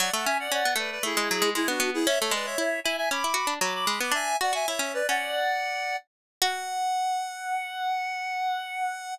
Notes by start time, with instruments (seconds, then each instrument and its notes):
0.00 harpsichord F#3, clarinet D5 F#5
0.13 harpsichord A3, clarinet F#5 A5
0.25 harpsichord C#4, clarinet E5 G#5
0.40 clarinet D5 F#5
0.52 harpsichord C#4, clarinet D5 F#5
0.65 harpsichord B3
0.76 harpsichord A3, clarinet B4 D5
0.91 clarinet B4 D5
1.03 harpsichord A3, clarinet E4 G#4
1.17 harpsichord G#3
1.31 harpsichord F#3
1.42 harpsichord G#3
1.55 harpsichord G#3, clarinet E4 G#4
1.68 harpsichord B3, clarinet D4 F#4
1.80 harpsichord B3
1.94 clarinet E4 G#4
2.07 harpsichord C#4, clarinet C#5 E5
2.20 harpsichord A3, clarinet A4 C#5
2.31 harpsichord G#3, clarinet B4 D5
2.45 clarinet C#5 E5
2.58 harpsichord E4, clarinet C#5 E5
2.84 harpsichord E4, clarinet E5 G#5
2.97 clarinet E5 G#5
3.11 harpsichord C#4, clarinet B5 D6
3.24 harpsichord E4
3.34 harpsichord F#4
3.47 harpsichord D4
3.61 harpsichord F#3, clarinet B5 D6
3.74 clarinet B5 D6
3.87 harpsichord G#3
4.00 harpsichord B3, clarinet B5 D6
4.12 harpsichord D4, clarinet E5 G#5
4.41 harpsichord F#4, clarinet D5 F#5
4.53 harpsichord F#4, clarinet E5 G#5
4.67 harpsichord E4, clarinet C#5 E5
4.79 harpsichord C#4, clarinet C#5 E5
4.94 clarinet B4 D5
5.08 harpsichord C#4, clarinet D5 F#5
6.42 harpsichord F#4, clarinet F#5